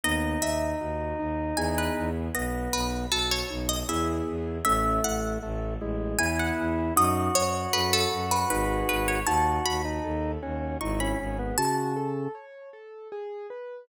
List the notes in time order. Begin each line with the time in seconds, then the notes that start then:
0.04 D#2 B3 D#4 D#5
0.41 D#2 D#4 E5
0.80 D#2 F#4
1.19 D#2 D#4
1.56 E2 B3 E4 G#4 G#5
1.78 B4
1.97 E2
2.35 B1 B3 D#5
2.73 B1 D#4 B4
3.10 B1 F#4 A4
3.31 C#5
3.50 B1 D#4
3.69 D#5
3.89 E2 B3 E4 G#4 E5
4.28 E2
4.65 A1 A3 C#4 E5
5.04 A1 E4 F#5
5.42 A1 A3 A4
5.81 A1 G#3 E4
6.18 E2 B3 E4 G#4 G#5
6.39 F#5
6.59 E2
6.96 F#2 D#4 F#4 D#5
7.34 F#2 F#4 C#5
7.73 F#2 A4 B4
7.93 A4
8.12 F#2 F#4
8.31 B4
8.50 G#1 D#4 G#4 B4
8.89 G#1 B4
9.08 C#5
9.27 D#2 D#4 F#4 A5
9.66 D#2 F#4 B5
9.85 D#4
10.04 D#2 A4
10.42 D#2 C#4 F#4
10.81 G#1 D#4 E4 C#6
11.00 C#4 B5
11.20 G#1 C#4 G#4
11.39 B3
11.58 C#3 F#4 A5
11.96 A4
12.35 C#5
12.73 A4
13.12 G#4
13.50 B4